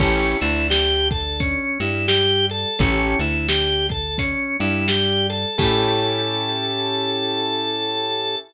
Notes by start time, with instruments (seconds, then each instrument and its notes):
0.00 electric bass (finger) A1, drawbar organ C#4, acoustic grand piano C#4 E4 G4 A4, kick, crash
0.41 electric bass (finger) D2, acoustic grand piano D3, drawbar organ E4, closed hi-hat
0.70 drawbar organ G4, snare
1.11 drawbar organ A4, kick, closed hi-hat
1.40 drawbar organ C#4, kick, closed hi-hat
1.80 electric bass (finger) G2, acoustic grand piano G3, drawbar organ E4, closed hi-hat
2.08 drawbar organ G4, snare
2.50 drawbar organ A4, closed hi-hat
2.79 electric bass (finger) A1, acoustic grand piano C#4 E4 G4 A4, drawbar organ C#4, kick, closed hi-hat
3.19 electric bass (finger) D2, acoustic grand piano D3, drawbar organ E4, closed hi-hat
3.48 drawbar organ G4, snare
3.89 drawbar organ A4, kick, closed hi-hat
4.18 drawbar organ C#4, kick, closed hi-hat
4.60 electric bass (finger) G2, acoustic grand piano G3, drawbar organ E4, closed hi-hat
4.88 drawbar organ G4, snare
5.30 drawbar organ A4, closed hi-hat
5.58 electric bass (finger) A2, acoustic grand piano C#4 E4 G4 A4, drawbar organ A4, kick, crash